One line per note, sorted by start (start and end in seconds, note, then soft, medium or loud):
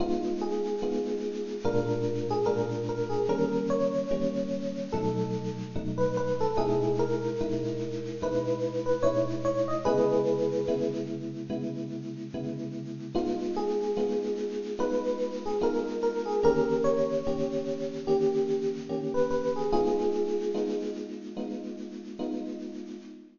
0.00 0.75 G#3 loud
0.00 0.75 B3 loud
0.00 0.75 D#4 loud
0.00 0.37 F4 medium
0.41 1.58 G#4 medium
0.82 1.57 G#3 loud
0.82 1.57 B3 loud
0.82 1.57 D#4 medium
0.82 1.57 F4 medium
1.65 2.40 A#2 loud
1.65 2.40 G#3 loud
1.65 2.40 D4 loud
1.65 2.40 F4 loud
1.65 2.17 A#4 medium
2.30 2.47 G#4 medium
2.46 3.22 A#2 medium
2.46 3.22 G#3 medium
2.46 3.22 D4 medium
2.46 3.22 F4 medium
2.46 2.68 A#4 medium
2.89 3.11 A#4 medium
3.09 3.26 G#4 medium
3.29 4.04 D#3 loud
3.29 4.04 G3 loud
3.29 4.04 A#3 loud
3.29 4.04 C#4 loud
3.29 3.65 A#4 medium
3.70 4.88 C#5 medium
4.11 4.86 D#3 medium
4.11 4.86 G3 medium
4.11 4.86 A#3 loud
4.11 4.86 C#4 loud
4.92 5.69 B2 loud
4.92 5.69 F#3 loud
4.92 5.69 A3 loud
4.92 5.69 D#4 medium
4.92 5.54 A4 medium
5.76 6.51 B2 medium
5.76 6.51 F#3 medium
5.76 6.51 A3 medium
5.76 6.51 D#4 loud
5.98 6.15 B4 medium
6.17 6.39 B4 medium
6.41 6.57 A4 medium
6.57 7.32 B2 loud
6.57 7.32 G#3 loud
6.57 7.32 D#4 loud
6.57 7.32 E4 loud
6.57 6.96 G#4 medium
6.99 8.08 A#4 medium
7.41 8.16 B2 medium
7.41 8.16 G#3 medium
7.41 8.16 D#4 medium
7.41 8.16 E4 medium
8.22 8.97 B2 medium
8.22 8.97 G#3 medium
8.22 8.97 D#4 medium
8.22 8.97 E4 medium
8.22 8.83 B4 medium
8.86 9.03 B4 medium
9.03 9.78 B2 medium
9.03 9.78 G#3 medium
9.03 9.78 D#4 medium
9.03 9.78 E4 loud
9.03 9.25 C#5 medium
9.45 9.67 C#5 medium
9.68 9.85 D#5 medium
9.85 10.61 C#3 loud
9.85 10.61 G#3 loud
9.85 10.61 B3 loud
9.85 10.61 E4 loud
9.85 10.89 G#4 medium
9.85 10.89 B4 medium
10.68 11.43 C#3 medium
10.68 11.43 G#3 medium
10.68 11.43 B3 medium
10.68 11.43 E4 loud
11.50 12.25 C#3 medium
11.50 12.25 G#3 loud
11.50 12.25 B3 medium
11.50 12.25 E4 medium
12.34 13.09 C#3 medium
12.34 13.09 G#3 medium
12.34 13.09 B3 medium
12.34 13.09 E4 medium
13.15 13.90 G#3 loud
13.15 13.90 B3 loud
13.15 13.90 D#4 loud
13.15 13.50 F4 medium
13.57 14.69 G#4 medium
13.97 14.72 G#3 medium
13.97 14.72 B3 loud
13.97 14.72 D#4 medium
13.97 14.72 F4 medium
14.79 15.54 G#3 loud
14.79 15.54 B3 medium
14.79 15.54 D#4 medium
14.79 15.54 F4 medium
14.79 15.32 B4 medium
15.46 15.63 G#4 medium
15.61 16.36 G#3 medium
15.61 16.36 B3 medium
15.61 16.36 D#4 loud
15.61 16.36 F4 loud
15.61 15.85 A#4 medium
16.03 16.25 A#4 medium
16.25 16.42 G#4 medium
16.43 17.18 D#3 loud
16.43 17.18 A#3 loud
16.43 17.18 C#4 loud
16.43 17.18 G4 loud
16.43 16.83 A#4 medium
16.84 17.92 C#5 medium
17.27 18.02 D#3 medium
17.27 18.02 A#3 medium
17.27 18.02 C#4 medium
17.27 18.02 G4 medium
18.07 18.83 D#3 medium
18.07 18.83 A#3 loud
18.07 18.83 C#4 medium
18.07 18.70 G4 medium
18.89 19.64 D#3 medium
18.89 19.64 A#3 medium
18.89 19.64 C#4 medium
18.89 19.64 G4 medium
19.14 19.30 B4 medium
19.30 19.53 B4 medium
19.56 19.72 G#4 medium
19.72 20.48 G#3 medium
19.72 20.48 B3 loud
19.72 20.48 D#4 loud
19.72 20.83 F4 medium
19.72 20.83 G#4 medium
20.54 21.30 G#3 medium
20.54 21.30 B3 medium
20.54 21.30 D#4 loud
20.54 21.30 F4 medium
21.37 22.12 G#3 medium
21.37 22.12 B3 medium
21.37 22.12 D#4 medium
21.37 22.12 F4 medium
22.19 22.94 G#3 medium
22.19 22.94 B3 medium
22.19 22.94 D#4 loud
22.19 22.94 F4 medium